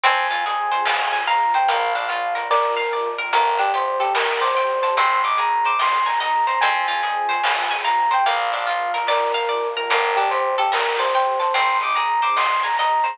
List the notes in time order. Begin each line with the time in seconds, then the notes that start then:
0.04 F2 C4 F4 G#4 G#5, kick, closed hi-hat
0.30 F4, closed hi-hat
0.46 G#4, closed hi-hat
0.71 C5, closed hi-hat
0.85 F5, snare
1.13 G#5, closed hi-hat
1.27 F5 A#5, closed hi-hat
1.54 C5 G5, closed hi-hat
1.68 A#1 A#3 D4 F4 F5, kick, closed hi-hat
1.95 D4 F5, closed hi-hat
2.08 F4 F5, closed hi-hat
2.35 A#4, closed hi-hat
2.50 A#4 D5, kick, snare
2.77 F5, high tom
2.92 D5, mid tom
3.18 A#4, floor tom
3.33 G1 A#3 D4 G4 A4 A#4, kick, closed hi-hat
3.59 D4 G4, closed hi-hat
3.74 G4 C5, closed hi-hat
4.00 G4 A4, closed hi-hat
4.15 A#4, snare
4.41 C5 D5, closed hi-hat
4.55 C5 G5, closed hi-hat
4.82 C5 A5, closed hi-hat
4.97 G#1 C4 D#4 G#4 C6, kick, closed hi-hat
5.24 D#4 D6, closed hi-hat
5.38 G#4 A#5, closed hi-hat
5.65 C5 D6, closed hi-hat
5.79 D#5 C6, snare
6.06 G#5 A#5, closed hi-hat
6.20 D#5 A#5, closed hi-hat
6.47 C5 A#5, closed hi-hat
6.61 F2 C4 F4 G#4 G#5, kick, closed hi-hat
6.88 F4, closed hi-hat
7.03 G#4, closed hi-hat
7.29 C5, closed hi-hat
7.43 F5, snare
7.71 G#5, closed hi-hat
7.84 F5 A#5, closed hi-hat
8.11 C5 G5, closed hi-hat
8.26 A#1 A#3 D4 F4 F5, kick, closed hi-hat
8.52 D4 F5, closed hi-hat
8.67 F4 F5, closed hi-hat
8.94 A#4, closed hi-hat
9.07 A#4 D5, kick, snare
9.34 F5, high tom
9.49 D5, mid tom
9.76 A#4, floor tom
9.90 G1 A#3 D4 G4 A4 A#4, kick, closed hi-hat
10.16 D4 G4, closed hi-hat
10.31 G4 C5, closed hi-hat
10.58 G4 A4, closed hi-hat
10.72 A#4, snare
10.99 C5 D5, closed hi-hat
11.14 C5 G5, closed hi-hat
11.39 C5 A5, closed hi-hat
11.54 G#1 C4 D#4 G#4 C6, kick, closed hi-hat
11.80 D#4 D6, closed hi-hat
11.95 G#4 A#5, closed hi-hat
12.22 C5 D6, closed hi-hat
12.36 D#5 C6, snare
12.63 G#5 A#5, closed hi-hat
12.76 D#5 A#5, closed hi-hat
13.03 C5 A#5, closed hi-hat